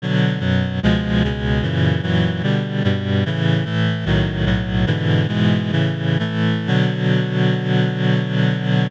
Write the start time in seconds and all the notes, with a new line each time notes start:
0.02 B2 D3 F#3
0.40 F#2 B2 F#3
0.83 C#2 B2 F3 G#3
1.23 C#2 B2 C#3 G#3
1.62 F#2 A#2 C#3 E3
2.02 F#2 A#2 E3 F#3
2.43 B2 D3 G3
2.84 G2 B2 G3
3.26 A2 C#3 E3
3.65 A2 E3 A3
4.05 B1 A2 D#3 F#3
4.45 B1 A2 B2 F#3
4.86 G#2 B2 D3 E3
5.28 G#2 B2 E3 G#3
5.71 A2 C#3 E3
6.19 A2 E3 A3
6.67 B2 D3 F#3